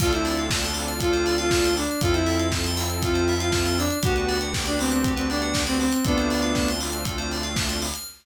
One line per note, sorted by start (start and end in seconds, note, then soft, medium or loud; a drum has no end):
0.00 1.86 D2 loud
0.00 1.81 C4 medium
0.00 1.81 D4 medium
0.00 1.81 F4 medium
0.00 0.12 F4 loud
0.00 1.81 A4 loud
0.00 0.12 A4 medium
0.00 kick medium
0.00 crash medium
0.13 0.45 E4 medium
0.13 0.25 C5 medium
0.13 closed hi-hat medium
0.25 0.37 D5 medium
0.25 open hi-hat medium
0.37 0.50 F5 medium
0.37 closed hi-hat medium
0.50 0.64 A5 medium
0.50 kick medium
0.50 snare loud
0.63 0.76 C6 medium
0.63 closed hi-hat medium
0.74 0.85 D6 medium
0.74 open hi-hat medium
0.88 0.99 F6 medium
0.88 closed hi-hat medium
1.00 1.35 F4 loud
1.00 1.11 A4 medium
1.00 kick medium
1.00 closed hi-hat medium
1.13 1.24 C5 medium
1.13 closed hi-hat medium
1.26 1.38 D5 medium
1.26 open hi-hat medium
1.38 1.74 F4 loud
1.38 1.50 F5 medium
1.38 closed hi-hat medium
1.51 1.63 A5 medium
1.51 kick medium
1.51 snare loud
1.64 1.77 C6 medium
1.64 closed hi-hat medium
1.77 2.00 D4 loud
1.77 1.88 D6 medium
1.77 open hi-hat medium
1.90 2.02 F6 medium
1.90 closed hi-hat medium
2.01 3.87 F2 loud
2.01 3.83 C4 loud
2.01 3.83 E4 medium
2.01 2.14 F4 loud
2.01 3.83 F4 medium
2.01 3.83 A4 medium
2.01 2.15 A4 medium
2.01 kick medium
2.01 closed hi-hat medium
2.14 2.47 E4 loud
2.14 2.26 C5 medium
2.14 closed hi-hat medium
2.26 2.38 E5 medium
2.26 open hi-hat medium
2.39 2.50 F5 medium
2.39 closed hi-hat medium
2.52 2.64 A5 medium
2.52 kick medium
2.52 snare medium
2.64 2.77 C6 medium
2.64 closed hi-hat medium
2.77 2.88 E6 medium
2.77 open hi-hat medium
2.90 3.01 F6 medium
2.90 closed hi-hat medium
3.02 3.34 F4 loud
3.02 3.13 A4 medium
3.02 kick medium
3.02 closed hi-hat medium
3.14 3.25 C5 medium
3.14 closed hi-hat medium
3.28 3.40 E5 medium
3.28 open hi-hat medium
3.40 3.77 F4 loud
3.40 3.51 F5 medium
3.40 closed hi-hat medium
3.52 3.64 A5 medium
3.52 kick medium
3.52 snare medium
3.66 3.78 C6 medium
3.66 closed hi-hat medium
3.78 3.98 D4 loud
3.78 3.91 E6 medium
3.78 open hi-hat medium
3.90 4.03 F6 medium
3.90 closed hi-hat medium
4.03 5.89 D2 loud
4.03 5.85 B3 loud
4.03 5.85 D4 medium
4.03 5.85 F#4 medium
4.03 4.38 F#4 loud
4.03 4.14 G4 loud
4.03 5.85 G4 medium
4.03 kick loud
4.03 closed hi-hat loud
4.16 4.29 B4 medium
4.16 closed hi-hat medium
4.28 4.40 D5 medium
4.28 open hi-hat medium
4.41 4.53 F#5 medium
4.41 closed hi-hat medium
4.54 4.65 G5 medium
4.54 kick medium
4.54 snare medium
4.66 4.79 D4 loud
4.66 4.78 B5 medium
4.66 closed hi-hat medium
4.79 4.91 C4 loud
4.79 4.92 D6 medium
4.79 open hi-hat medium
4.91 5.12 C4 loud
4.91 5.02 F#6 medium
4.91 closed hi-hat medium
5.04 5.17 G4 medium
5.04 kick medium
5.04 closed hi-hat medium
5.16 5.28 C4 loud
5.16 5.28 B4 medium
5.16 closed hi-hat medium
5.29 5.63 D4 loud
5.29 5.42 D5 medium
5.29 open hi-hat medium
5.42 5.53 F#5 medium
5.42 closed hi-hat medium
5.54 5.65 G5 medium
5.54 kick medium
5.54 snare loud
5.66 5.79 C4 loud
5.66 5.78 B5 medium
5.66 closed hi-hat medium
5.80 5.92 C4 loud
5.80 5.92 D6 medium
5.80 open hi-hat medium
5.91 6.04 C4 medium
5.91 6.03 F#6 medium
5.91 closed hi-hat medium
6.05 7.91 D2 loud
6.05 7.86 A3 medium
6.05 6.70 B3 loud
6.05 7.86 C4 medium
6.05 7.86 D4 medium
6.05 6.70 D4 loud
6.05 7.86 F4 loud
6.05 6.16 A4 medium
6.05 kick medium
6.05 closed hi-hat medium
6.17 6.29 C5 medium
6.17 closed hi-hat medium
6.30 6.42 D5 medium
6.30 open hi-hat medium
6.42 6.53 F5 medium
6.42 closed hi-hat medium
6.55 6.67 A5 medium
6.55 kick medium
6.55 snare medium
6.68 6.81 C6 medium
6.68 closed hi-hat medium
6.80 6.92 D6 medium
6.80 open hi-hat medium
6.92 7.03 F6 medium
6.92 closed hi-hat medium
7.05 7.16 A4 medium
7.05 kick medium
7.05 closed hi-hat medium
7.18 7.29 C5 medium
7.18 closed hi-hat medium
7.31 7.44 D5 medium
7.31 open hi-hat medium
7.43 7.55 F5 medium
7.43 closed hi-hat medium
7.56 7.67 A5 medium
7.56 kick medium
7.56 snare loud
7.69 7.81 C6 medium
7.69 closed hi-hat medium
7.82 7.93 D6 medium
7.82 open hi-hat medium
7.94 8.06 F6 medium
7.94 closed hi-hat medium